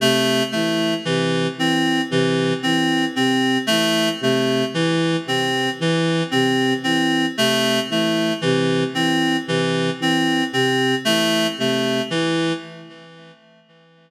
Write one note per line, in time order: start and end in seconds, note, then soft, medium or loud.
0.00 0.42 C3 medium
0.00 0.43 A3 medium
0.52 0.95 E3 medium
0.52 0.94 A3 medium
1.05 1.48 C3 medium
1.05 1.47 E3 medium
1.58 2.00 E3 medium
1.58 2.01 C4 medium
2.10 2.52 C3 medium
2.10 2.53 E3 medium
2.63 3.06 E3 medium
2.63 3.05 C4 medium
3.16 3.58 C3 medium
3.16 3.58 C4 medium
3.67 4.11 E3 medium
3.67 4.09 A3 medium
4.21 4.63 C3 medium
4.21 4.65 A3 medium
4.74 5.16 E3 medium
5.26 5.68 C3 medium
5.26 5.70 C4 medium
5.79 6.21 E3 medium
5.79 6.23 E3 medium
6.31 6.74 C3 medium
6.31 6.73 C4 medium
6.84 7.26 E3 medium
6.84 7.26 C4 medium
7.37 7.79 C3 medium
7.37 7.80 A3 medium
7.89 8.32 E3 medium
7.89 8.33 A3 medium
8.41 8.84 C3 medium
8.41 8.84 E3 medium
8.95 9.37 E3 medium
8.95 9.37 C4 medium
9.47 9.89 C3 medium
9.47 9.90 E3 medium
10.00 10.42 E3 medium
10.00 10.44 C4 medium
10.53 10.95 C3 medium
10.53 10.95 C4 medium
11.05 11.47 E3 medium
11.05 11.47 A3 medium
11.58 12.00 C3 medium
11.58 12.02 A3 medium
12.11 12.53 E3 medium